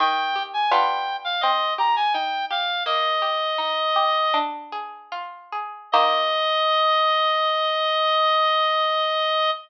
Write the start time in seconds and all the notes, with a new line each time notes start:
0.00 D#3 G5
0.36 G4
0.53 G#5
0.71 G3 B3 D4 F4 G5
1.24 F5
1.41 C4 D#5
1.78 G4 A#5
1.96 G#5
2.13 D#4 G5
2.50 G4 F5
2.86 A#3 D#5
3.22 G4
3.58 D#4
3.96 G4
4.34 D4
4.72 G#4
5.12 F4
5.52 G#4
5.92 D#3 A#3 G4 D#5